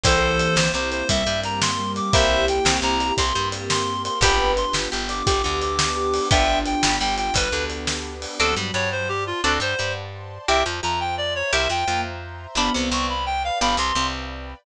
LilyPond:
<<
  \new Staff \with { instrumentName = "Clarinet" } { \time 12/8 \key g \major \tempo 4. = 115 <a' c''>4. c''8 c''8 c''8 e''4 bes''8 c'''4 d'''8 | <c'' e''>4 g''4 bes''4 c'''4 r8 c'''4 c'''8 | <g'' b''>4 c'''8 r4 d'''8 d'''8 d'''8 d'''2 | <e'' g''>4 g''4 g''8 g''8 b'4 r2 |
a'8 r8 des''8 c''8 g'8 f'8 a'8 c''4 r4. | e''8 r8 bes''8 g''8 d''8 cis''8 e''8 g''4 r4. | b''8 r8 cis'''8 b''8 g''8 f''8 b''8 c'''4 r4. | }
  \new Staff \with { instrumentName = "Ocarina" } { \time 12/8 \key g \major e2 r4 g2 g4 | g'2. g'2. | b'2 r4 g'2 g'4 | d'2 r1 |
fis2 r1 | r1 bes8 r4. | b2 r1 | }
  \new Staff \with { instrumentName = "Acoustic Guitar (steel)" } { \time 12/8 \key g \major <bes c' e' g'>4 r8 c8 c4 c8 g2~ g8 | <bes c' e' g'>4 r8 c8 c4 c8 g2~ g8 | <b d' f' g'>4 r8 g8 g4 g8 d2~ d8 | <b d' f' g'>4 r8 g8 g4 g8 d2~ d8 |
<c' d' fis' a'>8 g8 g2 <c' d' fis' a'>8 g8 g2 | <c' e' g' bes'>8 f8 f2 <c' e' g' bes'>8 f8 f2 | <b d' f' g'>8 c8 c2 <b d' f' g'>8 c8 c2 | }
  \new Staff \with { instrumentName = "Electric Bass (finger)" } { \clef bass \time 12/8 \key g \major c,4. c,8 c,4 c,8 g,2~ g,8 | c,4. c,8 c,4 c,8 g,2~ g,8 | g,,4. g,,8 g,,4 g,,8 d,2~ d,8 | g,,4. g,,8 g,,4 g,,8 d,2~ d,8 |
d,8 g,8 g,2 d,8 g,8 g,2 | c,8 f,8 f,2 c,8 f,8 f,2 | g,,8 c,8 c,2 g,,8 c,8 c,2 | }
  \new Staff \with { instrumentName = "Pad 5 (bowed)" } { \time 12/8 \key g \major <bes c' e' g'>2. <bes c' g' bes'>2. | <bes c' e' g'>2. <bes c' g' bes'>2. | <b d' f' g'>2. <b d' g' b'>2. | <b d' f' g'>2. <b d' g' b'>2. |
<c'' d'' fis'' a''>4. <c'' d'' a'' c'''>4. <c'' d'' fis'' a''>4. <c'' d'' a'' c'''>4. | <c'' e'' g'' bes''>4. <c'' e'' bes'' c'''>4. <c'' e'' g'' bes''>4. <c'' e'' bes'' c'''>4. | <b' d'' f'' g''>4. <b' d'' g'' b''>4. <b' d'' f'' g''>4. <b' d'' g'' b''>4. | }
  \new DrumStaff \with { instrumentName = "Drums" } \drummode { \time 12/8 <hh bd>4 hh8 sn4 hh8 <hh bd>4 hh8 sn4 hh8 | <hh bd>4 hh8 sn4 hh8 <hh bd>4 hh8 sn4 hh8 | <hh bd>4 hh8 sn4 hh8 <hh bd>4 hh8 sn4 hho8 | <hh bd>4 hh8 sn4 hh8 <hh bd>4 hh8 sn4 hho8 |
r4. r4. r4. r4. | r4. r4. r4. r4. | r4. r4. r4. r4. | }
>>